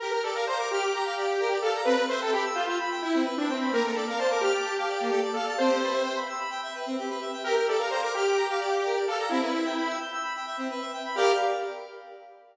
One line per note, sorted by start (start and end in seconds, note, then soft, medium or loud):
0.00 0.12 G4 medium
0.00 0.10 A#4 loud
0.11 0.22 A#4 medium
0.23 0.34 A4 medium
0.23 0.34 D5 medium
0.34 0.46 A#4 loud
0.34 0.45 F5 medium
0.47 0.58 C5 loud
0.47 0.58 A#5 medium
0.57 0.69 A#4 medium
0.57 0.68 D6 medium
0.71 1.58 G4 loud
0.71 0.81 F6 medium
0.81 0.91 D6 medium
0.94 1.04 A#5 medium
1.05 1.15 F5 medium
1.17 1.28 D5 medium
1.27 1.37 G4 medium
1.40 1.50 A#4 medium
1.52 1.62 D5 medium
1.62 1.81 A4 loud
1.62 1.73 F5 medium
1.75 1.85 A#5 medium
1.85 1.96 C4 medium
1.85 2.04 B4 loud
1.98 2.09 B4 medium
2.09 2.20 C5 loud
2.09 2.20 E5 medium
2.20 2.33 A4 loud
2.20 2.31 G5 medium
2.33 2.44 G4 loud
2.33 2.44 B5 medium
2.45 2.55 E6 medium
2.55 2.66 F4 loud
2.55 2.66 G6 medium
2.67 2.78 F4 loud
2.67 2.78 E6 medium
2.79 2.90 B5 medium
2.91 3.01 G5 medium
3.02 3.24 E4 loud
3.02 3.13 E5 medium
3.14 3.24 C4 medium
3.25 3.35 B4 medium
3.37 3.49 D4 loud
3.37 3.47 E5 medium
3.47 3.72 C4 loud
3.47 3.58 G5 medium
3.60 3.71 B5 medium
3.72 3.83 A#3 medium
3.72 3.83 A#4 loud
3.84 3.94 A4 medium
3.84 3.95 A#4 medium
3.94 4.05 A4 medium
3.94 4.06 D5 medium
4.07 4.18 A#4 medium
4.07 4.19 F5 medium
4.18 4.30 C5 medium
4.18 4.29 A5 medium
4.30 4.42 A#4 loud
4.30 4.40 D6 medium
4.41 5.21 G4 loud
4.41 4.52 F6 medium
4.53 4.64 D6 medium
4.65 4.75 A5 medium
4.78 4.88 F5 medium
4.89 4.99 D5 medium
5.00 5.11 A#3 medium
5.10 5.21 A4 medium
5.22 5.33 D5 medium
5.34 5.53 A4 medium
5.34 5.45 F5 medium
5.47 5.57 A5 medium
5.58 5.69 C4 loud
5.58 6.18 C5 loud
5.69 5.79 G4 medium
5.82 5.93 B4 medium
5.92 6.02 E5 medium
6.04 6.14 G5 medium
6.15 6.26 B5 medium
6.29 6.39 E6 medium
6.39 6.50 B5 medium
6.50 6.61 G5 medium
6.63 6.73 E5 medium
6.75 6.85 B4 medium
6.86 6.97 C4 medium
6.99 7.09 G4 medium
7.10 7.20 B4 medium
7.21 7.31 E5 medium
7.33 7.43 G5 medium
7.44 7.55 G4 loud
7.44 7.55 A#4 loud
7.54 7.65 A#4 medium
7.54 7.67 A#4 medium
7.68 7.79 A4 loud
7.68 7.78 D5 medium
7.78 7.91 A#4 medium
7.78 7.88 F5 medium
7.90 8.01 C5 medium
7.90 8.01 A#5 medium
8.01 8.12 A#4 loud
8.01 8.12 D6 medium
8.14 8.99 G4 loud
8.14 8.25 F6 medium
8.25 8.36 D6 medium
8.36 8.47 A#5 medium
8.50 8.60 F5 medium
8.60 8.70 D5 medium
8.71 8.81 G4 medium
8.85 8.96 A#4 medium
8.95 9.06 D5 medium
9.08 9.29 A4 loud
9.08 9.18 F5 medium
9.19 9.29 A#5 medium
9.29 9.41 C4 loud
9.29 9.97 E4 loud
9.42 9.52 B4 medium
9.54 9.64 E5 medium
9.65 9.75 G5 medium
9.77 9.87 B5 medium
9.89 9.99 E6 medium
10.01 10.12 G6 medium
10.12 10.23 E6 medium
10.23 10.33 B5 medium
10.36 10.46 G5 medium
10.46 10.57 E5 medium
10.57 10.68 C4 medium
10.70 10.81 B4 medium
10.81 10.91 E5 medium
10.93 11.03 G5 medium
11.05 11.15 B5 medium
11.15 11.32 G4 loud
11.15 11.32 A#4 loud
11.15 11.32 D5 loud
11.15 11.32 F5 loud